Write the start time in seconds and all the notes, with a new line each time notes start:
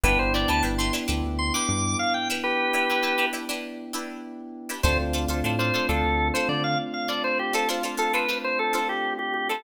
0.04 G1 B3 D4 E4 G4 B4
0.19 G1 C5
0.34 D4 E4 G4 B4 D5
0.48 D2 D4 E4 G4 B4 A5
0.63 G1 D4 E4 G4 B4
0.78 D4 E4 G4 B4 C6
0.93 D4 E4 G4 B4
1.08 D2 D4 E4 G4 B4
1.24 D2
1.39 C6
1.54 D4 E4 G4 B4 D6
1.69 G2 D6
1.99 F5
2.14 G5
2.30 D4 E4 G4 B4
2.44 G4 B4
2.73 D4 E4 G4 B4
2.90 D4 E4 G4 B4
3.03 D4 E4 G4 B4
3.18 D4 E4 G4 B4
3.33 D4 E4 G4 B4
3.49 D4 E4 G4 B4
3.93 D4 E4 G4 B4
4.69 D4 E4 G4 B4
4.83 D2 A3 C4 D4 F4 A4 C5
4.99 D2
5.13 D4 F4 A4 C5
5.28 D2 D4 F4 A4 C5
5.44 A2 D4 F4 A4 C5
5.59 D4 F4 A4 C5
5.74 D4 F4 A4 C5
5.89 D2 D4 F4 A4 C5
6.04 D2
6.34 D4 F4 A4 C5
6.49 D3 D5
6.64 F5
6.94 F5
7.08 D4 F4 A4 C5 D5
7.24 C5
7.39 G4
7.53 D4 F4 A4 C5
7.69 D4 F4 A4 C5
7.83 D4 F4 A4 C5
7.97 D4 F4 A4 C5
8.13 D4 F4 A4 B4 C5
8.29 D4 F4 A4 C5
8.44 C5
8.59 A4
8.73 D4 F4 A4 C5
8.89 G4
9.19 G4
9.34 G4
9.49 D4 F4 A4 C5